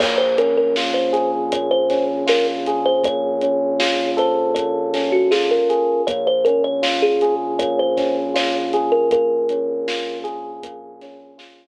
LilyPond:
<<
  \new Staff \with { instrumentName = "Kalimba" } { \time 4/4 \key bes \minor \tempo 4 = 79 des''16 c''16 bes'16 bes'16 r16 c''8 r16 des''16 c''8 r16 bes'16 r8 c''16 | des''4. c''8 des''8. ges'16 aes'16 bes'8. | des''16 c''16 bes'16 des''16 r16 aes'8 r16 des''16 c''8 r16 des''16 r8 bes'16 | bes'4. r2 r8 | }
  \new Staff \with { instrumentName = "Electric Piano 1" } { \time 4/4 \key bes \minor bes8 des'8 f'8 aes'8 bes8 des'8 f'8 aes'8 | bes8 des'8 f'8 a'8 bes8 des'8 f'8 aes'8 | bes8 des'8 f'8 aes'8 bes8 des'8 f'8 aes'8 | bes8 des'8 f'8 aes'8 bes8 des'8 f'8 r8 | }
  \new Staff \with { instrumentName = "Synth Bass 1" } { \clef bass \time 4/4 \key bes \minor bes,,1~ | bes,,1 | bes,,1~ | bes,,1 | }
  \new DrumStaff \with { instrumentName = "Drums" } \drummode { \time 4/4 <cymc bd>8 hh8 sn8 hh8 <hh bd>8 <hh bd sn>8 sn8 hh8 | <hh bd>8 hh8 sn8 hh8 <hh bd>8 <hh sn>8 sn8 hh8 | <hh bd>8 hh8 sn8 hh8 <hh bd>8 <hh bd sn>8 sn8 hh8 | <hh bd>8 hh8 sn8 hh8 <hh bd>8 <hh sn>8 sn4 | }
>>